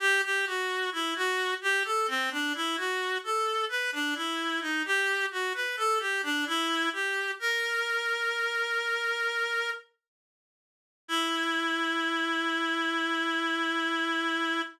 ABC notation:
X:1
M:4/4
L:1/16
Q:1/4=65
K:Em
V:1 name="Clarinet"
G G F2 E F2 G A C D E F2 A2 | B D E2 ^D G2 F B A G =D E2 G2 | ^A12 z4 | E16 |]